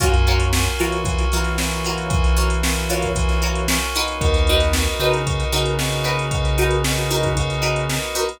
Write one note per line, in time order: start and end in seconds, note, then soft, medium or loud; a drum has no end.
0.00 0.68 F#2 medium
0.00 0.47 A#3 medium
0.00 0.47 C#4 medium
0.00 0.08 F4 loud
0.00 0.47 F4 medium
0.00 0.08 F#4 loud
0.00 0.47 F#4 medium
0.00 0.08 A#4 loud
0.00 0.08 C#5 loud
0.00 kick loud
0.00 closed hi-hat loud
0.14 closed hi-hat medium
0.27 0.46 F4 medium
0.27 0.46 F#4 loud
0.27 0.46 A#4 medium
0.27 0.46 C#5 medium
0.27 closed hi-hat medium
0.40 closed hi-hat medium
0.53 1.01 A#3 medium
0.53 1.01 C#4 medium
0.53 1.01 F4 medium
0.53 1.01 F#4 medium
0.53 snare loud
0.66 closed hi-hat medium
0.79 1.25 E3 medium
0.79 0.98 F4 medium
0.79 0.98 F#4 medium
0.79 0.98 A#4 loud
0.79 0.98 C#5 medium
0.79 closed hi-hat medium
0.92 closed hi-hat medium
1.05 1.53 A#3 medium
1.05 1.53 C#4 medium
1.05 1.53 F4 medium
1.05 1.53 F#4 medium
1.05 kick loud
1.05 closed hi-hat loud
1.18 closed hi-hat medium
1.32 3.79 E3 medium
1.32 1.51 F4 loud
1.32 1.51 F#4 medium
1.32 1.51 A#4 medium
1.32 1.51 C#5 medium
1.32 closed hi-hat medium
1.44 snare soft
1.44 closed hi-hat medium
1.58 2.07 A#3 medium
1.58 2.07 C#4 medium
1.58 2.07 F4 medium
1.58 2.07 F#4 medium
1.58 snare loud
1.71 closed hi-hat medium
1.85 2.04 F4 medium
1.85 2.04 F#4 medium
1.85 2.04 A#4 medium
1.85 2.04 C#5 medium
1.85 closed hi-hat medium
1.98 closed hi-hat medium
2.10 2.57 A#3 medium
2.10 2.57 C#4 medium
2.10 2.57 F4 medium
2.10 2.57 F#4 medium
2.10 kick loud
2.10 closed hi-hat loud
2.24 closed hi-hat medium
2.37 2.55 F4 medium
2.37 2.55 F#4 medium
2.37 2.55 A#4 medium
2.37 2.55 C#5 medium
2.37 snare soft
2.37 closed hi-hat medium
2.50 closed hi-hat medium
2.63 3.10 A#3 medium
2.63 3.10 C#4 medium
2.63 3.10 F4 medium
2.63 3.10 F#4 medium
2.63 snare loud
2.76 closed hi-hat medium
2.89 3.08 F4 loud
2.89 3.08 F#4 medium
2.89 3.08 A#4 medium
2.89 3.08 C#5 medium
2.89 closed hi-hat medium
3.02 kick medium
3.02 snare soft
3.02 closed hi-hat medium
3.15 3.63 A#3 medium
3.15 3.63 C#4 medium
3.15 3.63 F4 medium
3.15 3.63 F#4 medium
3.15 kick medium
3.15 closed hi-hat loud
3.29 snare soft
3.29 closed hi-hat medium
3.42 3.61 F4 loud
3.42 3.61 F#4 medium
3.42 3.61 A#4 medium
3.42 3.61 C#5 loud
3.42 closed hi-hat medium
3.55 closed hi-hat medium
3.68 4.17 A#3 medium
3.68 4.17 C#4 medium
3.68 4.17 F4 medium
3.68 4.17 F#4 medium
3.68 snare loud
3.81 closed hi-hat medium
3.94 4.31 D#4 loud
3.94 4.31 F#4 loud
3.94 4.31 A#4 loud
3.94 4.31 B4 loud
3.94 snare soft
3.94 closed hi-hat medium
4.08 closed hi-hat medium
4.21 4.88 D#2 medium
4.21 4.68 A#3 medium
4.21 4.68 B3 medium
4.21 4.68 D#4 medium
4.21 4.68 F#4 medium
4.21 kick loud
4.21 closed hi-hat loud
4.34 closed hi-hat medium
4.47 4.68 D#4 loud
4.47 4.68 F#4 loud
4.47 4.68 A#4 medium
4.47 4.68 B4 medium
4.47 closed hi-hat medium
4.60 snare soft
4.60 closed hi-hat medium
4.73 5.22 A#3 medium
4.73 5.22 B3 medium
4.73 5.22 D#4 medium
4.73 5.22 F#4 medium
4.73 snare loud
4.87 snare soft
4.87 closed hi-hat medium
4.99 5.44 C#3 medium
4.99 5.18 D#4 loud
4.99 5.18 F#4 medium
4.99 5.18 A#4 loud
4.99 5.18 B4 loud
4.99 closed hi-hat medium
5.13 closed hi-hat medium
5.26 5.74 A#3 medium
5.26 5.74 B3 medium
5.26 5.74 D#4 medium
5.26 5.74 F#4 medium
5.26 kick medium
5.26 closed hi-hat loud
5.40 closed hi-hat medium
5.52 7.99 C#3 medium
5.52 5.71 D#4 loud
5.52 5.71 F#4 medium
5.52 5.71 A#4 medium
5.52 5.71 B4 loud
5.52 closed hi-hat medium
5.66 closed hi-hat medium
5.79 6.26 A#3 medium
5.79 6.26 B3 medium
5.79 6.26 D#4 medium
5.79 6.26 F#4 medium
5.79 snare loud
5.92 closed hi-hat medium
6.04 6.22 D#4 medium
6.04 6.22 F#4 medium
6.04 6.22 A#4 medium
6.04 6.22 B4 medium
6.04 closed hi-hat medium
6.19 closed hi-hat medium
6.31 6.78 A#3 medium
6.31 6.78 B3 medium
6.31 6.78 D#4 medium
6.31 6.78 F#4 medium
6.31 kick loud
6.31 closed hi-hat loud
6.45 closed hi-hat medium
6.58 6.77 D#4 loud
6.58 6.77 F#4 medium
6.58 6.77 A#4 medium
6.58 6.77 B4 loud
6.58 closed hi-hat medium
6.71 closed hi-hat medium
6.84 7.32 A#3 medium
6.84 7.32 B3 medium
6.84 7.32 D#4 medium
6.84 7.32 F#4 medium
6.84 snare loud
6.98 closed hi-hat medium
7.10 7.29 D#4 medium
7.10 7.29 F#4 medium
7.10 7.29 A#4 loud
7.10 7.29 B4 medium
7.10 closed hi-hat medium
7.23 kick medium
7.23 closed hi-hat medium
7.37 7.84 A#3 medium
7.37 7.84 B3 medium
7.37 7.84 D#4 medium
7.37 7.84 F#4 medium
7.37 kick medium
7.37 closed hi-hat loud
7.50 closed hi-hat medium
7.62 7.80 D#4 medium
7.62 7.80 F#4 medium
7.62 7.80 A#4 medium
7.62 7.80 B4 medium
7.62 closed hi-hat medium
7.76 closed hi-hat medium
7.89 8.38 A#3 medium
7.89 8.38 B3 medium
7.89 8.38 D#4 medium
7.89 8.38 F#4 medium
7.89 snare loud
8.03 closed hi-hat medium
8.15 8.24 D#4 loud
8.15 8.24 F#4 medium
8.15 8.24 A#4 medium
8.15 8.24 B4 loud
8.15 closed hi-hat medium
8.29 closed hi-hat medium